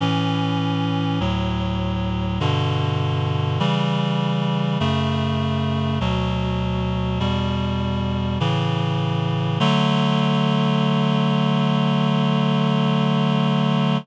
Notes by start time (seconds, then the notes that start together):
0.01 A2 E3 C#4
1.20 D2 A2 F#3
2.40 G2 B2 D3
3.60 C#3 E3 G3
4.80 F#2 C#3 A3
6.00 D2 B2 F#3
7.20 E2 B2 G3
8.40 A2 C#3 E3
9.60 D3 F#3 A3